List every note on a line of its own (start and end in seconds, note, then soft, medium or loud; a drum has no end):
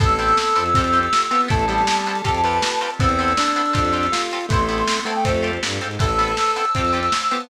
0.00 0.33 A1 medium
0.00 0.06 B3 loud
0.00 0.74 B3 medium
0.00 0.06 C4 loud
0.00 0.74 C4 medium
0.00 0.74 E4 medium
0.00 0.06 E4 loud
0.00 0.74 A4 medium
0.00 0.64 A4 loud
0.00 0.06 A4 loud
0.00 1.41 E6 loud
0.00 kick loud
0.00 closed hi-hat loud
0.09 closed hi-hat medium
0.19 0.32 B3 medium
0.19 0.32 C4 medium
0.19 0.32 E4 medium
0.19 0.32 A4 medium
0.19 closed hi-hat medium
0.29 closed hi-hat medium
0.37 snare loud
0.47 closed hi-hat medium
0.55 1.08 F2 medium
0.55 0.62 B3 medium
0.55 0.62 C4 medium
0.55 0.62 E4 medium
0.55 0.62 A4 medium
0.55 closed hi-hat medium
0.66 closed hi-hat medium
0.74 1.00 C4 medium
0.74 1.49 C4 medium
0.74 0.83 C4 loud
0.74 1.49 F4 medium
0.74 0.83 F4 medium
0.74 1.49 G4 medium
0.74 0.83 G4 loud
0.74 1.49 A4 medium
0.74 0.83 A4 loud
0.74 kick loud
0.74 closed hi-hat loud
0.84 closed hi-hat medium
0.93 1.06 C4 medium
0.93 1.06 F4 medium
0.93 1.06 G4 medium
0.93 1.06 A4 medium
0.93 closed hi-hat medium
1.03 closed hi-hat medium
1.13 snare loud
1.22 closed hi-hat medium
1.31 1.49 B3 loud
1.31 1.37 C4 medium
1.31 1.37 F4 medium
1.31 1.37 G4 medium
1.31 1.37 A4 medium
1.31 closed hi-hat medium
1.41 closed hi-hat medium
1.48 1.84 A1 medium
1.48 1.66 A3 loud
1.48 1.55 B3 medium
1.48 2.25 B3 medium
1.48 1.55 C4 medium
1.48 2.25 C4 medium
1.48 1.55 E4 loud
1.48 2.25 E4 medium
1.48 2.25 A4 medium
1.48 1.55 A4 loud
1.48 2.90 A5 loud
1.48 kick loud
1.48 closed hi-hat loud
1.59 closed hi-hat medium
1.68 2.22 G3 loud
1.68 1.81 B3 medium
1.68 1.81 C4 medium
1.68 1.81 E4 medium
1.68 1.81 A4 medium
1.68 closed hi-hat medium
1.78 closed hi-hat medium
1.87 snare loud
1.97 closed hi-hat medium
2.06 2.13 B3 medium
2.06 2.13 C4 medium
2.06 2.13 E4 medium
2.06 2.13 A4 medium
2.06 closed hi-hat medium
2.15 closed hi-hat medium
2.24 2.60 F2 medium
2.24 2.31 C4 loud
2.24 2.99 C4 medium
2.24 2.31 F4 loud
2.24 2.99 F4 medium
2.24 2.41 G4 medium
2.24 2.99 G4 medium
2.24 2.31 G4 medium
2.24 2.99 A4 medium
2.24 2.31 A4 loud
2.24 kick medium
2.24 closed hi-hat loud
2.35 closed hi-hat medium
2.44 2.57 C4 medium
2.44 2.57 F4 medium
2.44 2.57 G4 medium
2.44 2.57 A4 medium
2.44 2.91 B4 medium
2.44 closed hi-hat medium
2.53 closed hi-hat medium
2.62 snare loud
2.71 closed hi-hat medium
2.81 2.88 C4 medium
2.81 2.88 F4 medium
2.81 2.88 G4 medium
2.81 2.88 A4 medium
2.81 closed hi-hat medium
2.90 closed hi-hat medium
2.99 3.34 E2 medium
2.99 3.74 B3 medium
2.99 3.07 B3 medium
2.99 3.74 C4 medium
2.99 3.33 C4 loud
2.99 3.07 C4 medium
2.99 3.74 E4 medium
2.99 3.07 E4 medium
2.99 3.74 A4 medium
2.99 3.07 A4 loud
2.99 4.21 E6 medium
2.99 kick loud
2.99 closed hi-hat loud
3.09 closed hi-hat medium
3.19 3.32 B3 medium
3.19 3.32 C4 medium
3.19 3.32 E4 medium
3.19 3.32 A4 medium
3.19 closed hi-hat medium
3.28 snare soft
3.28 closed hi-hat medium
3.37 4.07 D4 loud
3.37 snare loud
3.47 snare soft
3.47 closed hi-hat medium
3.56 3.63 B3 medium
3.56 3.63 C4 medium
3.56 3.63 E4 medium
3.56 3.63 A4 medium
3.56 snare soft
3.56 closed hi-hat medium
3.66 closed hi-hat medium
3.73 4.09 F2 loud
3.73 3.80 C4 loud
3.73 4.49 C4 medium
3.73 3.80 F4 loud
3.73 4.49 F4 medium
3.73 3.80 G4 loud
3.73 4.49 G4 medium
3.73 4.49 A4 medium
3.73 3.80 A4 medium
3.73 kick loud
3.73 closed hi-hat loud
3.85 closed hi-hat medium
3.93 4.06 C4 medium
3.93 4.06 F4 medium
3.93 4.06 G4 medium
3.93 4.06 A4 medium
3.93 closed hi-hat medium
4.03 closed hi-hat medium
4.12 4.46 F4 medium
4.12 snare loud
4.22 closed hi-hat medium
4.31 4.39 C4 medium
4.31 4.39 F4 medium
4.31 4.39 G4 medium
4.31 4.39 A4 medium
4.31 closed hi-hat medium
4.41 closed hi-hat medium
4.49 4.83 A1 medium
4.49 5.00 A3 loud
4.49 5.24 B3 medium
4.49 4.57 B3 medium
4.49 5.24 C4 medium
4.49 4.57 C4 medium
4.49 5.24 E4 medium
4.49 4.57 E4 medium
4.49 5.24 A4 medium
4.49 5.03 C6 loud
4.49 kick loud
4.49 closed hi-hat loud
4.53 4.57 A4 medium
4.59 closed hi-hat medium
4.69 4.82 B3 medium
4.69 4.82 C4 medium
4.69 4.82 E4 medium
4.69 4.82 A4 medium
4.69 closed hi-hat medium
4.78 closed hi-hat medium
4.88 snare loud
4.96 snare soft
4.96 closed hi-hat medium
5.05 5.52 A3 loud
5.05 5.12 B3 medium
5.05 5.12 C4 medium
5.05 5.12 E4 medium
5.05 5.12 A4 medium
5.05 5.14 A5 medium
5.05 closed hi-hat medium
5.16 5.24 G5 medium
5.16 closed hi-hat medium
5.24 5.58 F2 medium
5.24 5.32 C4 loud
5.24 6.00 C4 medium
5.24 6.00 F4 medium
5.24 5.32 F4 medium
5.24 6.00 G4 medium
5.24 5.32 G4 loud
5.24 6.00 A4 medium
5.24 5.32 A4 medium
5.24 5.60 C5 medium
5.24 kick medium
5.24 closed hi-hat loud
5.34 closed hi-hat medium
5.43 5.56 C4 medium
5.43 5.56 F4 medium
5.43 5.56 G4 medium
5.43 5.56 A4 medium
5.43 closed hi-hat medium
5.53 closed hi-hat medium
5.63 5.79 G2 medium
5.63 snare loud
5.71 closed hi-hat medium
5.81 5.98 G#2 medium
5.81 5.88 C4 medium
5.81 5.88 F4 medium
5.81 5.88 G4 medium
5.81 5.88 A4 medium
5.81 closed hi-hat medium
5.91 closed hi-hat medium
5.99 6.34 A1 loud
5.99 6.06 B3 medium
5.99 6.06 C4 medium
5.99 6.06 E4 loud
5.99 6.06 A4 medium
5.99 6.65 A4 loud
5.99 6.37 B4 medium
5.99 6.37 C5 medium
5.99 6.37 E5 medium
5.99 6.37 A5 medium
5.99 7.43 E6 loud
5.99 kick loud
5.99 closed hi-hat loud
6.09 closed hi-hat medium
6.19 6.32 B3 medium
6.19 6.32 C4 medium
6.19 6.32 E4 medium
6.19 6.32 A4 medium
6.19 closed hi-hat loud
6.28 closed hi-hat medium
6.37 6.75 A4 medium
6.37 6.75 B4 medium
6.37 6.75 C5 medium
6.37 6.75 A5 medium
6.37 snare loud
6.47 closed hi-hat medium
6.56 6.63 B3 medium
6.56 6.63 C4 medium
6.56 6.63 E4 medium
6.56 6.63 A4 medium
6.56 closed hi-hat medium
6.65 closed hi-hat medium
6.75 7.09 F2 medium
6.75 7.00 C4 medium
6.75 6.82 C4 loud
6.75 6.82 F4 medium
6.75 6.82 G4 loud
6.75 6.82 A4 loud
6.75 7.12 C5 medium
6.75 7.12 F5 medium
6.75 7.12 G5 medium
6.75 7.12 A5 medium
6.75 kick medium
6.75 closed hi-hat loud
6.85 closed hi-hat medium
6.93 7.06 C4 medium
6.93 7.06 F4 medium
6.93 7.06 G4 medium
6.93 7.06 A4 medium
6.93 closed hi-hat medium
7.03 closed hi-hat medium
7.12 7.49 C5 medium
7.12 7.49 F5 medium
7.12 7.49 A5 loud
7.12 7.49 C6 medium
7.12 snare loud
7.22 closed hi-hat medium
7.31 7.49 B3 loud
7.31 7.38 C4 medium
7.31 7.38 F4 medium
7.31 7.38 G4 medium
7.31 7.38 A4 medium
7.31 closed hi-hat medium
7.41 closed hi-hat medium